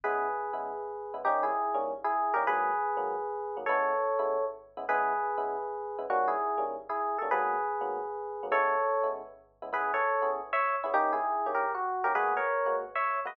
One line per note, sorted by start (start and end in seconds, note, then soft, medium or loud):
0.04 0.28 C#3 loud
0.04 0.28 G#3 loud
0.04 0.28 B3 loud
0.04 0.28 E4 medium
0.04 1.16 G#4 medium
0.04 1.16 B4 loud
0.53 0.72 C#3 medium
0.53 0.72 G#3 medium
0.53 0.72 B3 medium
0.53 0.72 E4 medium
1.14 1.21 C#3 medium
1.14 1.21 G#3 medium
1.14 1.21 B3 medium
1.14 1.21 E4 medium
1.25 1.50 D#3 loud
1.25 1.50 G3 loud
1.25 1.50 A#3 loud
1.25 1.50 C#4 loud
1.25 1.43 D#4 loud
1.25 1.43 G4 loud
1.43 1.78 E4 medium
1.43 1.78 G#4 loud
1.74 1.93 D#3 loud
1.74 1.93 G3 medium
1.74 1.93 A#3 medium
1.74 1.93 C#4 loud
2.04 2.34 E4 medium
2.04 2.34 G#4 loud
2.34 2.43 D#3 medium
2.34 2.43 G3 medium
2.34 2.43 A#3 loud
2.34 2.43 C#4 medium
2.34 2.44 G4 medium
2.34 2.44 A#4 loud
2.47 2.71 G#2 loud
2.47 2.71 F#3 loud
2.47 2.71 A#3 loud
2.47 2.71 B3 loud
2.47 3.57 G#4 loud
2.47 3.57 B4 loud
2.97 3.15 G#2 medium
2.97 3.15 F#3 medium
2.97 3.15 A#3 loud
2.97 3.15 B3 medium
3.57 3.64 G#2 medium
3.57 3.64 F#3 medium
3.57 3.64 A#3 medium
3.57 3.64 B3 medium
3.66 3.93 C#3 loud
3.66 3.93 G#3 loud
3.66 3.93 B3 loud
3.66 3.93 E4 loud
3.66 4.44 A4 medium
3.66 4.44 C#5 loud
4.19 4.37 C#3 medium
4.19 4.37 G#3 medium
4.19 4.37 B3 medium
4.19 4.37 E4 loud
4.77 4.85 C#3 loud
4.77 4.85 G#3 medium
4.77 4.85 B3 loud
4.77 4.85 E4 medium
4.89 5.13 C#3 loud
4.89 5.13 G#3 loud
4.89 5.13 B3 loud
4.89 5.13 E4 loud
4.89 5.98 G#4 loud
4.89 5.98 B4 loud
5.38 5.56 C#3 loud
5.38 5.56 G#3 medium
5.38 5.56 B3 medium
5.38 5.56 E4 medium
5.98 6.06 C#3 loud
5.98 6.06 G#3 medium
5.98 6.06 B3 medium
5.98 6.06 E4 medium
6.10 6.34 D#3 loud
6.10 6.34 G3 loud
6.10 6.34 A#3 loud
6.10 6.34 C#4 loud
6.10 6.29 F#4 loud
6.28 6.64 E4 medium
6.28 6.64 G#4 loud
6.58 6.76 D#3 medium
6.58 6.76 G3 medium
6.58 6.76 A#3 medium
6.58 6.76 C#4 medium
6.89 7.18 E4 medium
6.89 7.18 G#4 medium
7.18 7.29 D#3 medium
7.18 7.29 G3 medium
7.18 7.29 A#3 medium
7.18 7.29 C#4 loud
7.18 7.27 A4 medium
7.31 7.56 G#2 medium
7.31 7.56 F#3 loud
7.31 7.56 A#3 loud
7.31 7.56 B3 loud
7.31 8.46 G#4 loud
7.31 8.46 B4 loud
7.81 7.99 G#2 medium
7.81 7.99 F#3 medium
7.81 7.99 A#3 medium
7.81 7.99 B3 medium
8.43 8.50 G#2 medium
8.43 8.50 F#3 medium
8.43 8.50 A#3 medium
8.43 8.50 B3 medium
8.51 8.75 C#3 loud
8.51 8.75 G#3 medium
8.51 8.75 B3 loud
8.51 8.75 E4 loud
8.51 9.08 A4 loud
8.51 9.08 C#5 loud
9.03 9.22 C#3 medium
9.03 9.22 G#3 medium
9.03 9.22 B3 medium
9.03 9.22 E4 medium
9.62 9.70 C#3 loud
9.62 9.70 G#3 medium
9.62 9.70 B3 medium
9.62 9.70 E4 medium
9.73 9.96 C#3 loud
9.73 9.96 B3 loud
9.73 9.96 E4 loud
9.73 9.91 G#4 loud
9.73 9.91 B4 loud
9.94 10.30 A4 medium
9.94 10.30 C#5 loud
10.22 10.41 C#3 medium
10.22 10.41 B3 medium
10.22 10.41 E4 medium
10.22 10.41 G#4 medium
10.53 10.76 C#5 loud
10.53 10.76 E5 loud
10.83 10.93 C#3 medium
10.83 10.93 B3 medium
10.83 10.94 C#4 medium
10.83 10.94 E4 medium
10.83 10.93 G#4 medium
10.94 11.17 D#3 loud
10.94 11.17 A#3 loud
10.94 11.17 C#4 loud
10.94 11.12 D#4 loud
10.94 11.12 G4 loud
11.13 11.50 E4 medium
11.13 11.50 G#4 loud
11.46 11.65 D#3 medium
11.46 11.65 A#3 medium
11.46 11.65 C#4 medium
11.46 11.65 G4 medium
11.54 11.72 G4 medium
11.54 11.72 A#4 medium
11.75 12.04 F#4 loud
12.04 12.13 D#3 medium
12.04 12.13 A#3 medium
12.04 12.13 C#4 medium
12.04 12.13 G4 medium
12.04 12.13 A#4 loud
12.15 12.39 G#3 loud
12.15 12.39 A#3 loud
12.15 12.39 B3 loud
12.15 12.39 F#4 loud
12.15 12.33 G#4 loud
12.15 12.33 B4 loud
12.37 12.76 A#4 medium
12.37 12.76 C#5 loud
12.66 12.84 G#3 medium
12.66 12.84 A#3 medium
12.66 12.84 B3 medium
12.66 12.84 F#4 medium
12.95 13.20 C#5 medium
12.95 13.20 E5 loud
13.25 13.33 G#3 medium
13.25 13.33 A#3 medium
13.25 13.33 B3 medium
13.25 13.33 F#4 loud
13.25 13.36 B4 medium
13.25 13.36 D#5 loud